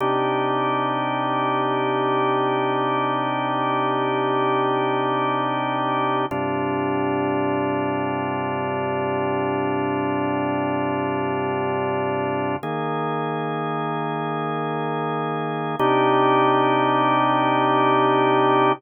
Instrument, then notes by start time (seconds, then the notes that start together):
drawbar organ
0.00 C3 D4 D#4 G4
6.31 G2 C3 D4 F4
12.63 D#3 A#3 G#4
15.79 C3 D4 D#4 G4